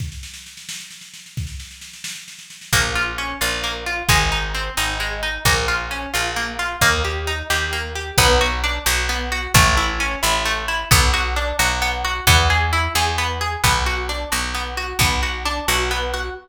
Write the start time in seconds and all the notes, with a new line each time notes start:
0.00 kick, snare
0.12 snare
0.23 snare
0.34 snare
0.46 snare
0.57 snare
0.69 snare
0.80 snare
0.91 snare
1.01 snare
1.14 snare
1.26 snare
1.37 kick, snare
1.47 snare
1.60 snare
1.71 snare
1.81 snare
1.93 snare
2.04 snare
2.16 snare
2.28 snare
2.39 snare
2.50 snare
2.61 snare
2.73 A#1 A#3, kick
2.95 F4
3.18 C#4
3.41 A#1 F4
3.64 A#3
3.86 F4
4.09 G#1 G#3, kick
4.32 D#4
4.55 C4
4.77 G#1 D#4
5.00 G#3
5.23 D#4
5.45 A#1 A#3, kick
5.68 F4
5.91 C#4
6.14 A#1 F4
6.36 A#3
6.59 F4
6.81 D#2 A#3, kick
7.05 G4
7.27 D#4
7.50 D#2 G4
7.73 A#3
7.95 G4
8.18 B1 B3, kick
8.41 F#4
8.64 D4
8.86 B1 F#4
9.09 B3
9.32 F#4
9.54 A1 A3, kick
9.77 E4
10.00 C#4
10.23 A1 E4
10.45 A3
10.68 E4
10.91 B1 B3, kick
11.14 F#4
11.36 D4
11.59 B1 F#4
11.82 B3
12.05 F#4
12.27 E2 B3, kick
12.50 G#4
12.73 E4
12.95 E2 G#4
13.18 B3
13.41 G#4
13.64 B1 B3, kick
13.86 F#4
14.09 D4
14.32 B1 F#4
14.55 B3
14.77 F#4
14.99 B1 B3, kick
15.23 F#4
15.45 D4
15.68 B1 F#4
15.91 B3
16.14 F#4